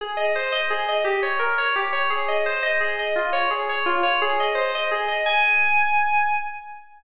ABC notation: X:1
M:6/8
L:1/8
Q:3/8=114
K:Ab
V:1 name="Electric Piano 2"
A e c e A e | G d B d G d | A e c e A e | F d A d F d |
A e c e A e | a6 |]